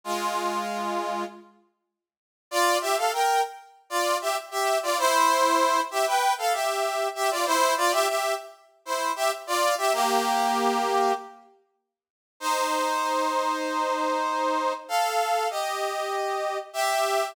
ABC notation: X:1
M:4/4
L:1/16
Q:1/4=97
K:Fdor
V:1 name="Brass Section"
[A,F]8 z8 | [K:Gdor] [Fd]2 [Ge] [Af] [Bg]2 z3 [Fd]2 [Ge] z [Ge]2 [Fd] | [Ec]6 [Ge] [=Bg]2 [Af] [Ge]4 [Ge] [Fd] | [Ec]2 [Fd] [Ge] [Ge]2 z3 [Ec]2 [Ge] z [Fd]2 [Ge] |
[B,G]8 z8 | [K:Fdor] [Ec]16 | [=Af]4 [Ge]8 [G=e]4 |]